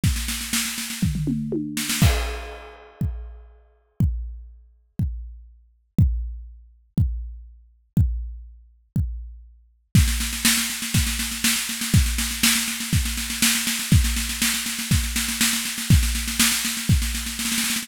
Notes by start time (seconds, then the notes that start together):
0.04 kick, snare
0.16 snare
0.28 snare
0.41 snare
0.53 snare
0.65 snare
0.78 snare
0.90 snare
1.02 kick, floor tom
1.15 floor tom
1.27 mid tom
1.52 high tom
1.77 snare
1.89 snare
2.02 kick, crash
3.01 kick
4.00 kick
4.99 kick
5.99 kick
6.98 kick
7.97 kick
8.96 kick
9.95 kick, snare
10.08 snare
10.20 snare
10.33 snare
10.45 snare
10.57 snare
10.70 snare
10.82 snare
10.94 kick, snare
11.07 snare
11.19 snare
11.32 snare
11.44 snare
11.56 snare
11.69 snare
11.81 snare
11.94 kick, snare
12.06 snare
12.18 snare
12.31 snare
12.43 snare
12.55 snare
12.68 snare
12.80 snare
12.93 kick, snare
13.05 snare
13.17 snare
13.30 snare
13.42 snare
13.55 snare
13.67 snare
13.79 snare
13.92 kick, snare
14.04 snare
14.16 snare
14.29 snare
14.42 snare
14.54 snare
14.66 snare
14.79 snare
14.91 kick, snare
15.04 snare
15.16 snare
15.29 snare
15.41 snare
15.53 snare
15.65 snare
15.78 snare
15.90 kick, snare
16.03 snare
16.15 snare
16.28 snare
16.40 snare
16.52 snare
16.65 snare
16.77 snare
16.89 kick, snare
17.02 snare
17.15 snare
17.26 snare
17.39 snare
17.45 snare
17.52 snare
17.58 snare
17.64 snare
17.70 snare
17.76 snare
17.83 snare